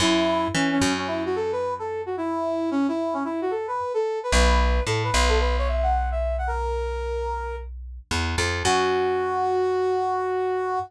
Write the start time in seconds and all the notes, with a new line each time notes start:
0.00 F#2 E4
0.54 E3 C#4
0.72 C#4
0.81 F#2
0.98 C#4
1.07 E4
1.26 F#4
1.36 A4
1.52 B4
1.79 A4
2.06 F#4
2.17 E4
2.71 C#4
2.88 E4
3.14 C#4
3.25 E4
3.42 F#4
3.51 A4
3.67 B4
3.94 A4
4.23 B4
4.32 B1 B4
4.86 A2 A4
5.04 B4
5.14 B1
5.29 A4
5.40 B4
5.58 C#5
5.68 E5
5.83 F#5
6.11 E5
6.38 F#5
6.47 A#4
8.11 E2
8.38 F2
8.65 F#2 F#4